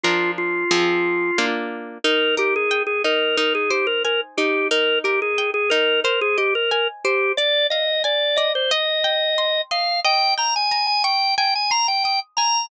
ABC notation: X:1
M:4/4
L:1/16
Q:1/4=90
K:Eb
V:1 name="Drawbar Organ"
F2 F8 z2 | B2 G A2 A B2 B A G B B z G2 | B2 G A2 A B2 B A G B B z G2 | d2 e2 d2 e c e6 f2 |
g2 b a2 a g2 g a b g g z b2 |]
V:2 name="Acoustic Guitar (steel)"
[F,DB]4 [F,CA]4 [B,DF]4 | E2 B2 g2 E2 E2 c2 a2 E2 | E2 B2 g2 E2 c2 e2 a2 c2 | d2 f2 a2 d2 e2 g2 c'2 e2 |
e2 g2 b2 _d'2 a2 c'2 e'2 a2 |]